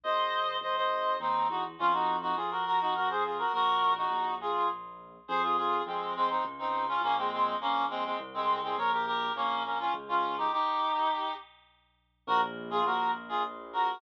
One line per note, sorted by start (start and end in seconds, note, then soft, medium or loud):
0.04 0.58 G#1 medium
0.04 0.56 C5 medium
0.04 0.56 D#5 medium
0.61 1.17 G#1 medium
0.61 0.76 C5 medium
0.61 0.76 D#5 medium
0.76 1.17 C5 medium
0.76 1.17 D#5 medium
1.20 1.46 D#2 medium
1.20 1.47 C4 medium
1.20 1.47 D#4 medium
1.49 1.75 E2 medium
1.49 1.63 D#4 medium
1.49 1.63 F#4 medium
1.79 2.33 F2 medium
1.79 1.93 C#4 medium
1.79 1.93 F4 loud
1.93 2.17 D#4 medium
1.93 2.17 F#4 medium
2.22 2.36 D#4 medium
2.22 2.36 F#4 medium
2.36 3.44 F2 medium
2.36 2.50 F4 medium
2.36 2.50 G#4 medium
2.51 2.65 F#4 medium
2.51 2.65 A#4 medium
2.66 2.80 F#4 medium
2.66 2.80 A#4 medium
2.81 2.95 D#4 medium
2.81 2.95 F#4 medium
2.95 3.09 F#4 medium
2.95 3.09 A#4 medium
3.10 3.23 G#4 medium
3.10 3.23 C5 medium
3.24 3.38 F4 medium
3.24 3.38 G#4 medium
3.38 3.52 F#4 medium
3.38 3.52 A#4 medium
3.53 4.07 A#1 medium
3.53 3.93 F#4 medium
3.53 3.93 A#4 loud
3.97 4.34 D#4 medium
3.97 4.34 F#4 medium
4.11 5.18 A#1 medium
4.41 4.68 F4 medium
4.41 4.68 G#4 medium
5.28 5.81 F2 medium
5.28 5.42 G#4 loud
5.28 5.42 C5 loud
5.42 5.56 F4 medium
5.42 5.56 G#4 medium
5.57 5.82 F4 medium
5.57 5.82 G#4 medium
5.86 6.39 F2 medium
5.86 6.14 G#3 medium
5.86 6.14 C4 medium
6.16 6.29 G#3 medium
6.16 6.29 C4 medium
6.30 6.44 C4 medium
6.30 6.44 D#4 medium
6.45 6.98 C#2 medium
6.59 6.85 C4 medium
6.59 6.85 D#4 medium
6.88 7.02 C#4 medium
6.88 7.02 F4 loud
7.02 7.54 A#1 medium
7.02 7.16 A#3 medium
7.02 7.16 C#4 loud
7.17 7.31 G#3 medium
7.17 7.31 C4 medium
7.32 7.56 G#3 medium
7.32 7.56 C4 medium
7.60 8.13 A#1 medium
7.60 7.86 A#3 medium
7.60 7.86 C#4 loud
7.90 8.04 G#3 medium
7.90 8.04 C4 loud
8.05 8.18 G#3 medium
8.05 8.18 C4 medium
8.19 8.73 C2 medium
8.34 8.60 G#3 medium
8.34 8.60 C4 medium
8.63 8.77 G#3 medium
8.63 8.77 C4 medium
8.77 9.29 A#1 medium
8.77 8.91 A#4 medium
8.77 8.91 C#5 medium
8.92 9.06 G4 medium
8.92 9.06 A#4 medium
9.06 9.32 G4 medium
9.06 9.32 A#4 loud
9.36 9.88 A#1 medium
9.36 9.63 A#3 medium
9.36 9.63 C#4 loud
9.65 9.78 A#3 medium
9.65 9.78 C#4 medium
9.79 9.93 C#4 medium
9.79 9.93 F4 loud
9.94 10.47 C#2 medium
10.08 10.36 C#4 medium
10.08 10.36 F4 medium
10.38 10.51 D#4 medium
10.38 10.51 G4 medium
10.52 11.34 D#4 medium
10.52 11.34 G4 loud
12.27 12.81 A#1 loud
12.27 12.41 F#4 loud
12.27 12.41 A#4 loud
12.70 12.84 F4 medium
12.70 12.84 G#4 loud
12.85 13.93 A#1 medium
12.85 13.11 F#4 medium
12.85 13.11 A#4 medium
13.29 13.43 F4 medium
13.29 13.43 G#4 loud
13.73 13.99 F#4 medium
13.73 13.99 A#4 medium